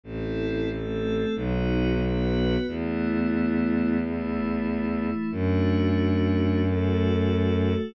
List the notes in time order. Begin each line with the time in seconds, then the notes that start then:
0.03 A1 C4 E4 A4
0.69 A3 C4 A4
1.35 B1 B3 D#4 F#4
2.01 B3 F#4 B4
2.67 E2 A3 B3 E4
4.00 E3 A3 E4
5.31 F#2 A3 D4 F#4
6.63 A3 F#4 A4